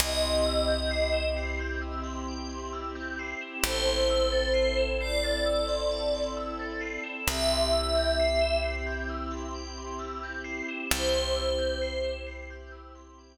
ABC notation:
X:1
M:4/4
L:1/16
Q:1/4=66
K:C
V:1 name="Pad 5 (bowed)"
^d6 z10 | c6 d6 z4 | e6 z10 | c6 z10 |]
V:2 name="Tubular Bells"
g c' e' g' c'' e'' c'' g' e' c' g c' e' g' c'' e'' | a c' e' a' c'' e'' c'' a' e' c' a c' e' a' c'' e'' | g c' e' g' c'' e'' c'' g' e' c' g c' e' g' c'' e'' | g c' e' g' c'' e'' c'' g' e' c' g z5 |]
V:3 name="Electric Bass (finger)" clef=bass
C,,16 | A,,,16 | C,,16 | C,,16 |]
V:4 name="Pad 2 (warm)"
[CEG]16 | [CEA]16 | [CEG]16 | [CEG]16 |]